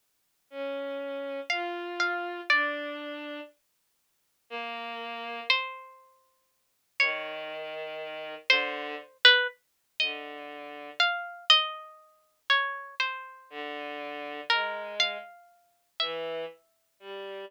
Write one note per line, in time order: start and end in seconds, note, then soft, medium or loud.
0.50 1.40 C#4 medium
1.50 2.40 F4 medium
1.50 1.95 F5 medium
2.00 2.45 F5 medium
2.50 3.40 D4 medium
2.50 3.40 D5 medium
4.50 5.40 A#3 loud
5.50 6.85 C5 medium
6.99 8.34 D#3 medium
6.99 8.35 C#5 medium
8.50 8.95 D3 loud
8.50 9.17 C5 medium
9.25 9.47 B4 loud
10.00 10.90 D3 medium
10.00 10.90 D#5 medium
11.00 11.45 F5 medium
11.50 12.40 D#5 loud
12.50 12.95 C#5 medium
13.00 14.35 C5 medium
13.50 14.40 D3 medium
14.50 15.17 G#3 medium
14.50 14.95 A#4 medium
15.00 15.90 F5 medium
16.00 16.45 E3 medium
16.00 17.35 E5 medium
16.99 17.44 G3 medium